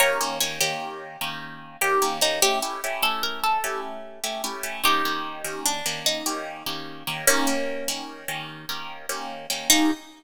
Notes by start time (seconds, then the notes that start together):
0.00 D#3 A#3 C#4 G4 A#4 C#5
0.21 D#3 A#3 C#4 G4
0.40 D#3 A#3 C#4 G4 C#5
0.61 D#3 A#3 C#4 G4
1.21 D#3 A#3 C#4 G4
1.81 D#3 A#3 C#4 G4
2.02 D#3 A#3 C#4 G4
2.21 D#3 A#3 C#4 D#4 G4
2.42 A3 C#4 E4 G4
2.62 A3 C#4 E4 G4
2.84 A3 C#4 E4 G4
3.02 A3 C#4 E4 G4 A4
3.23 A#4
3.44 A4
3.64 A3 C#4 E4 G4
4.24 A3 C#4 E4 G4
4.44 A3 C#4 E4 G4
4.63 A3 C#4 E4 G4
4.84 D#3 A#3 C#4 D#4 G4
5.05 D#3 A#3 C#4 G4
5.44 D#3 A#3 C#4 G4
5.66 D4
5.86 D#3 A#3 C#4 G4
6.06 D#4
6.26 D#3 A#3 C#4 G4
6.66 D#3 A#3 C#4 G4
7.07 D#3 A#3 C#4 G4
7.27 D#3 A#3 C#4 G4
7.47 D#3 A#3 C#4 G4
7.88 D#3 A#3 C#4 G4
8.28 D#3 A#3 C#4 G4
8.69 D#3 A#3 C#4 G4
9.09 D#3 A#3 C#4 G4
9.50 D#3 A#3 C#4 G4
9.70 D#3 A#3 C#4 D#4 G4